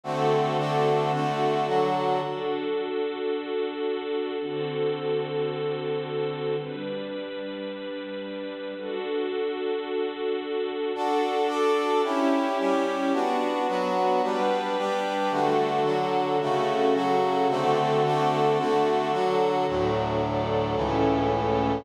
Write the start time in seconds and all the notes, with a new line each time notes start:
0.04 D3 A3 C4 F#4 A4
0.58 D3 A3 D4 F#4
1.13 D3 A3 D4 F#4 A4
1.67 D3 F#3 F#4
2.22 D4 F#4 A4
4.40 D3 C4 F#4 A4
6.58 G3 D4 B4
8.76 D4 F#4 A4
10.94 D4 F#4 A4
11.47 D4 A4 D5
12.04 C#4 E4 G4
12.59 G3 C#4 G4
13.13 B3 D4 F#4
13.68 F#3 B3 F#4
14.22 G3 B3 D4 B4
14.78 G3 D4 G4
15.31 D3 A3 D4 F#4 A4
15.84 D3 F#3 F#4
16.40 C#3 A3 C#4 F#4 A4
16.94 C#3 F#3 F#4
17.49 D3 A3 C4 F#4 A4
18.04 D3 A3 D4 F#4
18.58 D3 A3 D4 F#4 A4
19.12 D3 F#3 F#4
19.67 D2 A2 F#3 D4 F#4 A4
20.22 D4 A4 D5
20.75 C#2 A2 E3 C#4 E4 A4
21.31 A3 C#4 A4